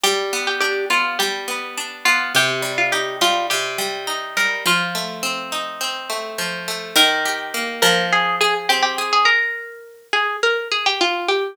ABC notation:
X:1
M:4/4
L:1/16
Q:1/4=104
K:Bb
V:1 name="Pizzicato Strings"
G3 G G2 F2 G6 F2 | G3 F G2 F2 G6 B2 | F10 z6 | [K:Eb] B6 B2 A2 A z G G z A |
B6 A2 B2 A G F2 G2 |]
V:2 name="Pizzicato Strings"
G,2 =B,2 D2 B,2 G,2 B,2 D2 B,2 | C,2 G,2 E2 G,2 C,2 G,2 E2 G,2 | F,2 A,2 C2 E2 C2 A,2 F,2 A,2 | [K:Eb] E,2 G2 B,2 F,4 A2 C2 A2 |
z16 |]